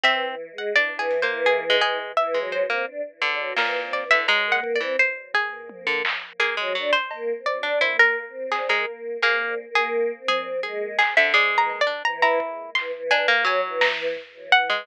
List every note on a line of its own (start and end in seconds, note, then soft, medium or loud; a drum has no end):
0.03 0.26 E3 medium
0.03 0.35 C4 loud
0.03 0.52 E5 loud
0.28 0.49 E3 medium
0.51 0.72 G#3 loud
0.58 0.74 F#5 medium
0.73 0.89 E3 medium
0.73 1.18 D4 medium
0.73 0.97 D5 loud
0.92 1.24 E3 loud
0.99 1.20 G#4 medium
1.11 closed hi-hat medium
1.22 1.65 A#3 medium
1.22 1.43 C5 medium
1.28 1.76 E3 loud
1.46 1.78 G#4 medium
1.70 2.12 G#3 loud
1.81 1.98 E3 medium
1.81 2.13 G#4 loud
2.17 2.38 E3 loud
2.17 2.49 E5 medium
2.34 2.66 G#3 medium
2.40 2.62 F#3 loud
2.52 3.47 C5 medium
2.65 2.86 C4 medium
2.70 2.86 A#3 medium
2.85 3.01 D4 medium
3.21 3.53 D3 medium
3.21 3.39 D4 medium
3.39 3.55 F#3 medium
3.56 4.04 A#2 medium
3.56 3.79 E3 medium
3.56 3.90 A#4 medium
3.56 snare medium
3.82 4.03 C4 medium
3.93 4.09 D5 medium
4.02 4.24 E3 medium
4.11 4.27 D3 medium
4.11 4.26 E5 loud
4.28 4.60 G#3 loud
4.28 4.49 A#5 medium
4.47 4.78 A#3 loud
4.52 4.73 F#5 medium
4.64 kick medium
4.75 4.97 D5 medium
4.80 4.96 E3 medium
4.80 4.96 C4 loud
4.99 5.31 C5 medium
5.34 6.30 G#4 medium
5.34 floor tom loud
5.69 6.02 A#3 medium
5.69 high tom loud
5.87 6.02 D3 medium
6.05 clap loud
6.40 6.55 A#3 medium
6.40 6.87 G#4 medium
6.57 6.76 F#3 loud
6.57 6.73 G#3 medium
6.75 6.91 F#3 medium
6.75 6.92 D4 loud
6.93 7.40 C5 loud
7.11 7.32 A#3 loud
7.11 cowbell medium
7.36 7.58 C4 medium
7.46 7.78 D5 medium
7.46 floor tom medium
7.59 7.80 D4 loud
7.59 7.79 D4 medium
7.81 8.24 A#3 medium
7.81 7.97 E4 medium
7.81 7.97 C5 medium
7.99 8.47 A#4 loud
8.27 8.69 C4 medium
8.51 8.67 G#4 medium
8.51 clap medium
8.69 8.85 G#3 medium
8.69 9.17 A#4 medium
8.74 9.17 A#3 medium
9.22 9.64 A#3 medium
9.22 9.55 A#3 loud
9.22 9.70 G#4 soft
9.69 10.12 A#3 loud
9.75 10.23 G#4 loud
9.93 floor tom medium
10.18 10.60 C4 medium
10.28 10.60 G#4 loud
10.28 high tom medium
10.63 10.97 G#3 loud
10.63 10.95 G#4 medium
10.99 11.14 G#4 medium
10.99 clap medium
11.17 11.33 D3 medium
11.17 11.33 E5 loud
11.34 11.81 G#3 loud
11.34 11.55 D5 medium
11.52 11.68 E3 medium
11.58 11.79 A#5 loud
11.69 cowbell medium
11.81 12.02 D5 medium
11.87 12.03 D4 medium
12.05 12.22 E3 loud
12.05 12.21 A#5 medium
12.05 cowbell soft
12.22 12.39 E3 loud
12.22 12.70 E4 medium
12.22 12.70 A#5 medium
12.40 kick medium
12.75 12.91 E3 medium
12.75 13.07 C6 loud
12.75 clap medium
12.95 13.11 E3 medium
13.11 13.44 E3 medium
13.11 13.27 D4 loud
13.11 13.42 G#5 loud
13.11 cowbell medium
13.28 13.44 A#3 loud
13.45 13.92 F#3 medium
13.45 13.61 F#3 loud
13.45 13.78 G#5 medium
13.65 14.13 E3 loud
13.81 14.45 A#5 medium
13.81 snare loud
14.16 floor tom medium
14.34 14.50 E3 medium
14.51 14.83 E3 medium
14.51 14.84 F#5 loud
14.51 kick medium
14.70 14.85 G#3 medium